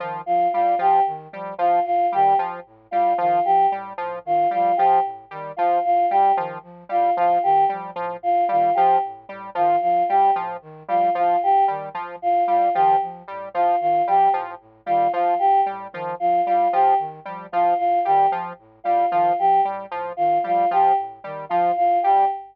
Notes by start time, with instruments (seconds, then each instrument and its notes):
0.00 flute D#3, lead 1 (square) F3
0.26 flute F3, choir aahs F4
0.53 flute A2, lead 1 (square) G3, choir aahs F4
0.79 flute A2, lead 1 (square) F3, choir aahs G4
1.06 flute D#3
1.32 flute F3, lead 1 (square) G3
1.58 flute A2, lead 1 (square) F3, choir aahs F4
1.85 flute A2, choir aahs F4
2.12 flute D#3, lead 1 (square) G3, choir aahs G4
2.38 flute F3, lead 1 (square) F3
2.66 flute A2
2.91 flute A2, lead 1 (square) G3, choir aahs F4
3.18 flute D#3, lead 1 (square) F3, choir aahs F4
3.45 flute F3, choir aahs G4
3.72 flute A2, lead 1 (square) G3
3.98 flute A2, lead 1 (square) F3
4.25 flute D#3, choir aahs F4
4.51 flute F3, lead 1 (square) G3, choir aahs F4
4.77 flute A2, lead 1 (square) F3, choir aahs G4
5.04 flute A2
5.31 flute D#3, lead 1 (square) G3
5.57 flute F3, lead 1 (square) F3, choir aahs F4
5.84 flute A2, choir aahs F4
6.10 flute A2, lead 1 (square) G3, choir aahs G4
6.37 flute D#3, lead 1 (square) F3
6.63 flute F3
6.89 flute A2, lead 1 (square) G3, choir aahs F4
7.17 flute A2, lead 1 (square) F3, choir aahs F4
7.43 flute D#3, choir aahs G4
7.69 flute F3, lead 1 (square) G3
7.96 flute A2, lead 1 (square) F3
8.21 flute A2, choir aahs F4
8.49 flute D#3, lead 1 (square) G3, choir aahs F4
8.75 flute F3, lead 1 (square) F3, choir aahs G4
9.04 flute A2
9.29 flute A2, lead 1 (square) G3
9.55 flute D#3, lead 1 (square) F3, choir aahs F4
9.81 flute F3, choir aahs F4
10.09 flute A2, lead 1 (square) G3, choir aahs G4
10.36 flute A2, lead 1 (square) F3
10.62 flute D#3
10.88 flute F3, lead 1 (square) G3, choir aahs F4
11.14 flute A2, lead 1 (square) F3, choir aahs F4
11.41 flute A2, choir aahs G4
11.68 flute D#3, lead 1 (square) G3
11.94 lead 1 (square) F3, flute F3
12.21 flute A2, choir aahs F4
12.48 flute A2, lead 1 (square) G3, choir aahs F4
12.74 flute D#3, lead 1 (square) F3, choir aahs G4
13.01 flute F3
13.28 flute A2, lead 1 (square) G3
13.53 flute A2, lead 1 (square) F3, choir aahs F4
13.81 flute D#3, choir aahs F4
14.06 flute F3, lead 1 (square) G3, choir aahs G4
14.34 flute A2, lead 1 (square) F3
14.60 flute A2
14.86 flute D#3, lead 1 (square) G3, choir aahs F4
15.12 lead 1 (square) F3, flute F3, choir aahs F4
15.39 flute A2, choir aahs G4
15.66 flute A2, lead 1 (square) G3
15.92 flute D#3, lead 1 (square) F3
16.20 flute F3, choir aahs F4
16.46 flute A2, lead 1 (square) G3, choir aahs F4
16.73 flute A2, lead 1 (square) F3, choir aahs G4
16.99 flute D#3
17.25 flute F3, lead 1 (square) G3
17.52 flute A2, lead 1 (square) F3, choir aahs F4
17.78 flute A2, choir aahs F4
18.05 flute D#3, lead 1 (square) G3, choir aahs G4
18.31 flute F3, lead 1 (square) F3
18.58 flute A2
18.84 flute A2, lead 1 (square) G3, choir aahs F4
19.11 flute D#3, lead 1 (square) F3, choir aahs F4
19.39 flute F3, choir aahs G4
19.64 flute A2, lead 1 (square) G3
19.90 flute A2, lead 1 (square) F3
20.17 flute D#3, choir aahs F4
20.43 flute F3, lead 1 (square) G3, choir aahs F4
20.71 flute A2, lead 1 (square) F3, choir aahs G4
20.98 flute A2
21.24 flute D#3, lead 1 (square) G3
21.49 lead 1 (square) F3, flute F3, choir aahs F4
21.76 flute A2, choir aahs F4
22.03 flute A2, lead 1 (square) G3, choir aahs G4